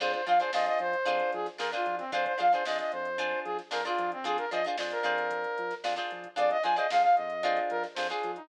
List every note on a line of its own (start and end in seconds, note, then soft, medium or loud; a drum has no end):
0.00 0.15 F2 loud
0.00 0.21 D4 loud
0.00 0.21 F4 loud
0.00 0.21 G#4 loud
0.00 0.12 C5 medium
0.00 0.21 C5 medium
0.00 kick medium
0.00 crash loud
0.12 0.25 C5 medium
0.12 closed hi-hat medium
0.26 0.41 F3 medium
0.26 0.37 D4 medium
0.26 0.37 F4 medium
0.26 0.37 G#4 medium
0.26 0.37 C5 medium
0.26 0.39 F5 medium
0.26 closed hi-hat medium
0.39 0.50 D4 medium
0.39 0.50 F4 medium
0.39 0.50 G#4 medium
0.39 0.51 C5 medium
0.39 0.50 C5 medium
0.39 closed hi-hat medium
0.53 0.69 F2 loud
0.53 0.96 D4 medium
0.53 0.96 F4 medium
0.53 0.96 G#4 medium
0.53 0.96 C5 loud
0.53 0.66 D#5 medium
0.53 snare loud
0.66 0.79 D#5 medium
0.66 snare soft
0.66 closed hi-hat medium
0.79 0.95 F3 loud
0.79 1.31 C5 medium
0.79 closed hi-hat medium
0.93 closed hi-hat medium
1.05 1.22 F2 loud
1.05 1.48 D4 loud
1.05 1.48 F4 loud
1.05 1.48 G#4 medium
1.05 1.48 C5 loud
1.05 kick medium
1.05 closed hi-hat medium
1.20 closed hi-hat medium
1.33 1.49 F3 medium
1.33 1.47 G#4 medium
1.33 snare soft
1.33 closed hi-hat medium
1.46 snare soft
1.46 closed hi-hat medium
1.58 1.74 F2 medium
1.58 1.69 D4 medium
1.58 1.69 F4 medium
1.58 1.69 G#4 medium
1.58 1.71 A#4 medium
1.58 1.69 C5 medium
1.58 snare medium
1.72 2.04 D4 medium
1.72 2.04 F4 medium
1.72 1.96 F4 medium
1.72 2.04 G#4 medium
1.72 2.04 C5 medium
1.72 closed hi-hat medium
1.86 2.01 F3 medium
1.86 closed hi-hat medium
1.98 2.11 C4 medium
1.98 snare soft
1.98 closed hi-hat medium
2.12 2.27 F2 loud
2.12 2.34 D4 loud
2.12 2.34 F4 loud
2.12 2.34 G#4 medium
2.12 2.25 C5 medium
2.12 2.34 C5 loud
2.12 kick loud
2.12 closed hi-hat medium
2.25 2.38 C5 medium
2.25 kick medium
2.25 closed hi-hat medium
2.38 2.55 F3 loud
2.38 2.48 D4 medium
2.38 2.48 F4 medium
2.38 2.48 G#4 medium
2.38 2.48 C5 medium
2.38 2.52 F5 medium
2.38 snare soft
2.38 closed hi-hat medium
2.52 2.63 D4 medium
2.52 2.63 F4 medium
2.52 2.63 G#4 medium
2.52 2.65 C5 medium
2.52 2.63 C5 medium
2.52 snare soft
2.52 closed hi-hat medium
2.65 2.81 F2 medium
2.65 3.09 D4 medium
2.65 3.09 F4 medium
2.65 3.09 G#4 medium
2.65 3.09 C5 medium
2.65 2.78 D#5 medium
2.65 snare loud
2.79 2.92 D#5 medium
2.79 snare soft
2.79 closed hi-hat medium
2.92 3.34 F2 loud
2.92 3.40 C5 medium
2.92 closed hi-hat medium
3.05 closed hi-hat medium
3.18 3.61 D4 medium
3.18 3.61 F4 loud
3.18 3.61 G#4 loud
3.18 3.61 C5 medium
3.18 kick medium
3.18 closed hi-hat medium
3.45 3.60 F3 medium
3.45 3.57 G#4 medium
3.45 closed hi-hat medium
3.59 snare soft
3.59 closed hi-hat medium
3.71 3.88 F2 medium
3.71 3.81 D4 medium
3.71 3.81 F4 medium
3.71 3.81 G#4 medium
3.71 3.84 A#4 medium
3.71 3.81 C5 medium
3.71 snare loud
3.85 4.17 D4 medium
3.85 4.11 F4 medium
3.85 4.17 F4 medium
3.85 4.17 G#4 medium
3.85 4.17 C5 medium
3.85 closed hi-hat medium
3.98 4.13 F3 loud
3.98 closed hi-hat medium
4.12 4.25 C4 medium
4.12 closed hi-hat medium
4.24 4.39 F2 loud
4.24 4.45 D4 loud
4.24 4.45 F4 loud
4.24 4.37 G#4 loud
4.24 4.45 G#4 loud
4.24 4.45 C5 loud
4.24 kick medium
4.24 closed hi-hat medium
4.37 4.50 A#4 medium
4.37 snare soft
4.37 closed hi-hat medium
4.51 4.67 F3 medium
4.51 4.62 D4 medium
4.51 4.62 F4 medium
4.51 4.62 G#4 medium
4.51 4.62 C5 medium
4.51 4.65 D#5 medium
4.51 closed hi-hat medium
4.64 4.76 D4 medium
4.64 4.76 F4 medium
4.64 4.76 G#4 medium
4.64 4.76 C5 medium
4.64 closed hi-hat medium
4.78 4.94 F2 loud
4.78 5.03 D4 medium
4.78 5.03 F4 medium
4.78 5.04 G#4 medium
4.78 5.04 C5 medium
4.78 snare loud
4.91 5.75 A#4 medium
4.91 closed hi-hat medium
5.03 5.46 F2 loud
5.03 5.72 D4 loud
5.03 5.72 F4 loud
5.03 5.72 G#4 medium
5.03 5.72 C5 loud
5.03 closed hi-hat medium
5.18 closed hi-hat medium
5.31 kick medium
5.31 closed hi-hat medium
5.44 closed hi-hat medium
5.58 5.73 F3 medium
5.58 closed hi-hat medium
5.71 snare soft
5.71 closed hi-hat medium
5.84 5.99 F2 medium
5.84 5.94 D4 medium
5.84 5.94 F4 medium
5.84 5.94 G#4 medium
5.84 5.94 C5 medium
5.84 snare loud
5.96 6.28 D4 medium
5.96 6.28 F4 medium
5.96 6.28 G#4 medium
5.96 6.28 C5 medium
5.96 closed hi-hat medium
6.11 6.27 F3 medium
6.11 closed hi-hat medium
6.24 kick medium
6.24 closed hi-hat medium
6.36 6.53 F2 loud
6.36 6.57 D4 loud
6.36 6.57 F4 medium
6.36 6.57 G#4 loud
6.36 6.57 C5 loud
6.36 6.50 D5 medium
6.36 kick medium
6.36 closed hi-hat loud
6.50 6.63 D#5 loud
6.50 closed hi-hat medium
6.63 6.79 F3 medium
6.63 6.74 D4 medium
6.63 6.74 F4 medium
6.63 6.74 G#4 medium
6.63 6.74 C5 medium
6.63 6.76 G#5 medium
6.63 closed hi-hat medium
6.76 6.87 D4 medium
6.76 6.87 F4 medium
6.76 6.87 G#4 medium
6.76 6.87 C5 medium
6.76 6.90 D#5 medium
6.76 closed hi-hat medium
6.90 7.06 F2 loud
6.90 7.34 D4 medium
6.90 7.34 F4 medium
6.90 7.34 G#4 medium
6.90 7.34 C5 medium
6.90 7.02 F5 medium
6.90 snare loud
7.03 7.15 F5 medium
7.03 snare soft
7.03 closed hi-hat medium
7.16 7.60 F2 loud
7.16 7.60 D#5 medium
7.16 closed hi-hat medium
7.30 closed hi-hat medium
7.43 7.86 D4 loud
7.43 7.86 F4 loud
7.43 7.86 G#4 loud
7.43 7.86 C5 medium
7.43 kick medium
7.43 closed hi-hat medium
7.56 snare soft
7.56 closed hi-hat medium
7.70 7.86 F3 medium
7.70 7.83 A#4 medium
7.70 closed hi-hat medium
7.84 snare medium
7.84 closed hi-hat medium
7.95 8.12 F2 loud
7.95 8.07 D4 medium
7.95 8.07 F4 medium
7.95 8.07 G#4 medium
7.95 8.08 C5 medium
7.95 8.07 C5 medium
7.95 snare loud
8.09 8.41 D4 medium
8.09 8.41 F4 medium
8.09 8.31 G#4 medium
8.09 8.41 G#4 medium
8.09 8.41 C5 medium
8.09 closed hi-hat medium
8.23 8.38 F3 medium
8.23 closed hi-hat medium
8.36 8.48 D#4 medium
8.36 closed hi-hat medium